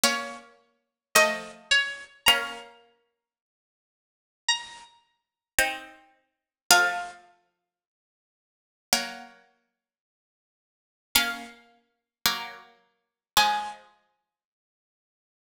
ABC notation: X:1
M:4/4
L:1/8
Q:1/4=54
K:Bbm
V:1 name="Pizzicato Strings"
d2 e d | b4 b4 | f6 z2 | f4 a4 |]
V:2 name="Pizzicato Strings"
[B,D]2 [F,=A,]2 | [B,D]6 [CE]2 | [F,=A,]4 [G,B,]3 z | [B,D]2 [G,B,]2 [F,A,]4 |]